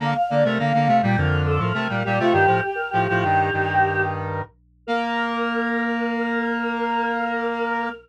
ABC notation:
X:1
M:4/4
L:1/16
Q:1/4=103
K:Bb
V:1 name="Choir Aahs"
f f d B f3 g B2 A B B2 G F | "^rit." G2 G B G8 z4 | B16 |]
V:2 name="Lead 1 (square)"
[D,B,] z [D,B,] [C,A,] [D,B,] [D,B,] [C,A,] [B,,G,] [F,,D,]3 [A,,F,] [C,A,] [B,,G,] [B,,G,] [C,A,] | "^rit." [G,,E,] [A,,F,] z2 [A,,F,] [A,,F,] [G,,E,]2 [G,,E,]6 z2 | B,16 |]